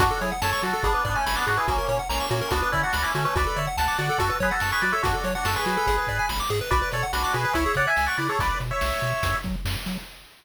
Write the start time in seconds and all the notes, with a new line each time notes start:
0.00 F#2 D4 F#4, kick, closed hi-hat
0.11 A4
0.21 F#3 E4 G#4 C#5, closed hi-hat
0.32 F#5
0.42 F#2 A4 C#5 A5, snare
0.53 C#6
0.63 F#3 F#4 A4, closed hi-hat
0.73 A4
0.83 G#1 B3 D4 G#4, kick, closed hi-hat
0.94 B4
1.05 G#2 B3 D4 D5, kick, closed hi-hat
1.15 A3 C#4 G#5
1.26 G#1 B5, snare
1.36 B3 D4 D6
1.47 G#2 D4 F#4 G#4, closed hi-hat
1.57 E4 G#4 B4
1.68 A#1 A#3 C#4 F#4, kick, closed hi-hat
1.78 A#4
1.88 A#2 A#3 C#4 C#5, closed hi-hat
1.99 F#5
2.09 A#1 A#3 C#4 A#5, snare
2.20 C#6
2.30 A#2 A#3 C#4 F#4, closed hi-hat
2.41 A#4
2.51 D2 B3 D4 F#4, kick, closed hi-hat
2.62 B4
2.72 D3 C#4 E4 D5, kick, closed hi-hat
2.83 D4 F#4 F#5
2.93 D2 B5, snare
3.02 C#4 E4 D6
3.15 D3 A3 C#4 F#4, closed hi-hat
3.25 A3 C#4 B4
3.36 D2 F#4 B4 D5, kick, closed hi-hat
3.47 A4
3.56 D3 C#5 D5 E5, closed hi-hat
3.67 F#5
3.77 D2 F#5 A5, snare
3.88 D6
3.98 D3 F#4 D5 F#5, closed hi-hat
4.09 A4
4.18 F#2 F#4 A4, kick, closed hi-hat
4.30 B4
4.40 F#3 G#4 B4 C#5, kick, closed hi-hat
4.51 F#4 A4 F#5
4.60 F#2 A5, snare
4.72 G#4 B4 C#6
4.82 F#3 F#4 B4 D5, closed hi-hat
4.92 A4 C#5 E5
5.03 F#2 D4 F#4, kick, closed hi-hat
5.14 A4
5.24 F#3 C#5, closed hi-hat
5.35 D4 F#4 F#5
5.45 F#2 F#4 A4 A5, snare
5.56 G#4 B4 C#6
5.66 F#3 F#4, closed hi-hat
5.77 A4
5.87 G#1 G#4, kick, closed hi-hat
5.98 B4
6.07 G#2 D5, kick, closed hi-hat
6.19 G#5
6.29 G#1 B5, snare
6.40 D6
6.49 G#2 G#4, closed hi-hat
6.61 B4
6.71 B1 F#4 B4 D5, kick, closed hi-hat
6.82 B4
6.92 B2 A4 C#5 D5, closed hi-hat
7.03 F#5
7.13 B1 D4 F#4 B5, snare
7.24 D6
7.33 B2 F#4 G#4 B4, closed hi-hat
7.45 B4
7.53 C#2 E4 C#5 E5, kick, closed hi-hat
7.66 G#4
7.75 C#3 C#5 D5 F#5, kick, closed hi-hat
7.87 E5 G#5
7.96 C#2 G#5, snare
8.06 D5 F#5 C#6
8.17 C#3 E4 B4 D5, closed hi-hat
8.29 G#4 A4 C#5
8.39 B1 B4 D5, kick, closed hi-hat
8.60 B2, closed hi-hat
8.71 C#5 E5
8.81 B1, snare
9.01 B2, closed hi-hat
9.23 F#2, kick, closed hi-hat
9.43 F#3, kick, closed hi-hat
9.65 F#2, snare
9.86 F#3, closed hi-hat